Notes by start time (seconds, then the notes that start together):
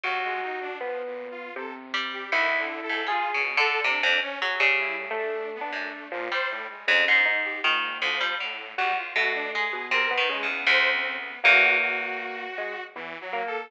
0.03 D#2 F#3 F#4
0.24 G#3
0.42 D#4
0.61 D4
0.79 F3 B3
1.06 A#2
1.31 F4
1.56 C3 A4
1.94 G3
2.13 G4
2.32 D2 D#3 E4
2.58 D3
2.83 A4
2.89 G#2
3.07 G3 F4 G#4
3.34 B2 C#3
3.57 D3 A4
3.84 C3 D4
4.03 F2
4.22 C#4
4.41 F#3 G#4
4.60 C#3 G3
4.79 E4
4.98 A2
5.11 A3
5.17 D4
5.55 B3
5.61 D4
5.73 F#2 A3
6.12 A#2 F3
6.32 G3 C5
6.50 A2
6.69 G#3
6.87 F2 G#2 C#3
7.07 G#2 D#4
7.25 G#2 D#4
7.44 G4
7.63 G#2 A#2 D#3
8.01 D2 F3
8.21 G3
8.40 A2 D3
8.77 E2 G3 F#4
8.97 F4
9.16 B2 A3 F#4
9.34 D4
9.53 G#3 G#4
9.73 B2
9.91 C3 A#4
10.10 D#3 B3
10.18 D#3
10.29 C#3 G#3
10.43 E2
10.48 B3
10.67 D2 C5
10.93 C4
11.18 B3
11.43 E2 A#3 F#4
11.81 F#4
12.58 G#3
12.95 E2 E3
13.21 F#3
13.33 A#3
13.47 A4